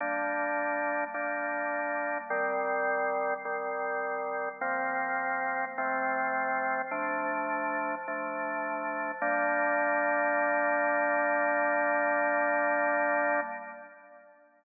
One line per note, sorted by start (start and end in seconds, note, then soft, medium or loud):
0.00 1.04 G3 medium
0.00 1.04 A#3 medium
0.00 1.04 D4 medium
1.14 2.18 G3 medium
1.14 2.18 A#3 medium
1.14 2.18 D4 medium
2.30 3.34 D#3 medium
2.30 3.34 G3 medium
2.30 3.34 C4 medium
3.45 4.49 D#3 medium
3.45 4.49 G3 medium
3.45 4.49 C4 medium
4.61 5.65 F3 medium
4.61 5.65 A#3 medium
4.61 5.65 C4 loud
5.78 6.82 F3 medium
5.78 6.82 A3 medium
5.78 6.82 C4 loud
6.91 7.95 F3 medium
6.91 7.95 A3 medium
6.91 7.95 D4 medium
8.08 9.12 F3 medium
8.08 9.12 A3 medium
8.08 9.12 D4 medium
9.22 13.40 G3 loud
9.22 13.40 A#3 loud
9.22 13.40 D4 medium